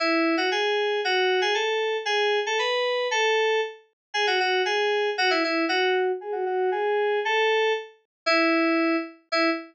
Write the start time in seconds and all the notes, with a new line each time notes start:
0.00 E4
0.37 F#4
0.52 G#4
1.05 F#4
1.41 G#4
1.54 A4
2.05 G#4
2.46 A4
2.59 B4
3.11 A4
4.14 G#4
4.27 F#4
4.40 F#4
4.65 G#4
5.18 F#4
5.30 E4
5.44 E4
5.69 F#4
6.21 G#4
6.32 F#4
6.46 F#4
6.72 G#4
7.25 A4
8.26 E4
9.32 E4